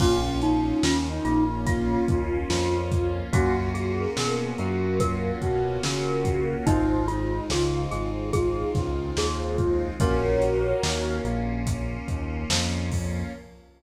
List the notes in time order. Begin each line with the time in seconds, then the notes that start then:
0.00 A#1 A#3 C#4 F4, kick, crash
0.42 D#4, closed hi-hat
0.83 D#2 D#3 C#4 F4, snare
1.08 D#4
1.25 A#1 A#3 F4, closed hi-hat
1.66 F4, kick, closed hi-hat
2.08 D#2 D#3 F4, kick, closed hi-hat
2.50 F2 F3 F4, snare
2.92 kick, closed hi-hat
3.33 F#2 A#3 C#4 F4 F#4, kick, closed hi-hat
3.74 F#4 G#4, closed hi-hat
4.00 A#4
4.17 B2 B3 G#4 A#4, snare
4.58 F#2 F#3 F#4 A#4, closed hi-hat
5.00 F4 A#4, kick, closed hi-hat
5.41 B2 B3 F#4, kick, closed hi-hat
5.83 C#3 C#4 A#4, snare
6.25 kick, closed hi-hat
6.66 G#1 G#3 C4 D#4 F4, kick, closed hi-hat
7.08 D#4 F4, closed hi-hat
7.50 C#2 C#3 F4 G#4, snare
7.75 F4
7.91 G#1 G#3 G#4, closed hi-hat
8.33 F4 G#4, kick, closed hi-hat
8.75 C#2 C#3 F4, kick, snare, closed hi-hat
9.17 D#2 D#3 G#4, snare
9.58 kick, closed hi-hat
10.00 A#1 A#3 C#4 F4 F#4 A#4 C#5, kick, closed hi-hat
10.42 closed hi-hat
10.83 D#2 D#3, snare
11.24 A#1 A#3, closed hi-hat
11.67 kick, closed hi-hat
12.08 D#2 D#3, kick, closed hi-hat
12.50 F2 F3, snare
12.91 kick, open hi-hat